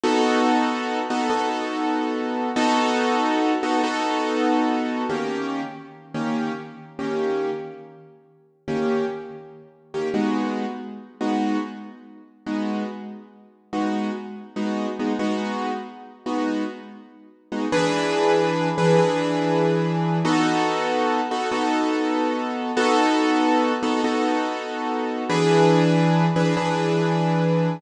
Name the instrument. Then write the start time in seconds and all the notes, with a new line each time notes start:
acoustic grand piano
0.04 B3 D#4 F#4 A4
1.10 B3 D#4 F#4 A4
1.30 B3 D#4 F#4 A4
2.56 B3 D#4 F#4 A4
3.63 B3 D#4 F#4 A4
3.84 B3 D#4 F#4 A4
5.09 D#3 A#3 C#4 G4
6.14 D#3 A#3 C#4 G4
6.99 D#3 A#3 C#4 G4
8.68 D#3 A#3 C#4 G4
9.94 D#3 A#3 C#4 G4
10.14 G#3 B3 D#4 F#4
11.21 G#3 B3 D#4 F#4
12.46 G#3 B3 D#4 F#4
13.73 G#3 B3 D#4 F#4
14.56 G#3 B3 D#4 F#4
14.99 G#3 B3 D#4 F#4
15.19 G#3 B3 D#4 F#4
16.26 G#3 B3 D#4 F#4
17.52 G#3 B3 D#4 F#4
17.72 E3 D4 G#4 B4
18.78 E3 D4 G#4 B4
18.98 E3 D4 G#4 B4
20.25 B3 D#4 F#4 A4
21.31 B3 D#4 F#4 A4
21.51 B3 D#4 F#4 A4
22.77 B3 D#4 F#4 A4
23.83 B3 D#4 F#4 A4
24.04 B3 D#4 F#4 A4
25.29 E3 D4 G#4 B4
26.36 E3 D4 G#4 B4
26.57 E3 D4 G#4 B4